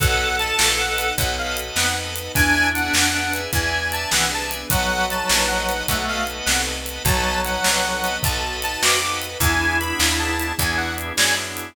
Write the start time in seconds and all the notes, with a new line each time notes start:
0.00 B1 B3 D#4 F#4 A4 B4 D#5 F#5 A5, kick, closed hi-hat
0.39 B4 D#5 F#5 A5, closed hi-hat
0.59 A#1 B3 D#4 A4 B4, snare
0.78 B4 D#5 F#5 A5
0.98 B4 D#5 F#5 A5, closed hi-hat
1.18 B1 B3 D#4 F#4 A4 B4 D#5 F#5 A5, kick, closed hi-hat
1.38 F5
1.57 closed hi-hat
1.76 F2 B3 D#4 A4 B4 F#5, snare
1.96 B4 D#5 F#5 A5
2.16 closed hi-hat
2.35 E2 B3 D4 E4 G#4 B4 D5 E5 G#5, kick, closed hi-hat
2.74 B4 D5 E5 F#5 G#5, closed hi-hat
2.93 F2 B3 D4 G#4 B4, snare
3.14 B4 D5 E5 G#5
3.33 B4 D5 E5 G#5, closed hi-hat
3.53 E2 B3 D4 E4 G#4 B4 D5 E5 G#5, kick, closed hi-hat
3.92 A5, closed hi-hat
4.11 C2 E3 B3 D4 G#4 B4 F#5, snare
4.31 B4 D5 E5 G#5 A5
4.51 closed hi-hat
4.70 B1 F#3 B3 D#4 F#4 A4 B4 D#5 F#5 A5, kick, closed hi-hat
5.10 B4 D#5 F#5 A5, closed hi-hat
5.29 A#1 B3 D#4 A4 B4, snare
5.47 B4 D#5 F#5 A5
5.69 B4 D#5 F#5 A5, closed hi-hat
5.88 B1 A3 B3 D#4 F#4 A4 B4 D#5 F#5 A5, kick, closed hi-hat
6.08 F5
6.27 closed hi-hat
6.45 C2 B3 D#4 A4 B4 F#5, snare
6.67 B4 D#5 F#5 A5
6.86 closed hi-hat
7.05 B1 F#3 B3 D#4 F#4 A4 B4 D#5 F#5 A5, kick, closed hi-hat
7.45 B4 D#5 F#5 A5, closed hi-hat
7.64 C2 B3 D#4 A4 B4, snare
7.84 B4 D#5 F#5 A5
8.04 B4 D#5 F#5 A5, closed hi-hat
8.23 B1 B3 D#4 F#4 A4 A5, kick, closed hi-hat
8.62 A5, closed hi-hat
8.82 F2 B3 D#4 F#4 A4 B4 D6, snare
9.01 B4 D#5 F#5 A5 D6
9.22 closed hi-hat
9.40 E2 B3 D4 E4 G#4 G#5, kick, closed hi-hat
9.61 B3 D4 E4 G#4
9.80 B3 D4 E4 G#4 B5, closed hi-hat
9.99 D#2, snare
10.19 A5
10.39 closed hi-hat
10.59 E2 B3 D4 E4 G#4 G#5, kick, closed hi-hat
10.77 F#5
10.98 closed hi-hat
11.17 F#2 B3 D4 E4 G#4 D5 G#5, snare
11.37 B3 D4 E4 G#4
11.57 closed hi-hat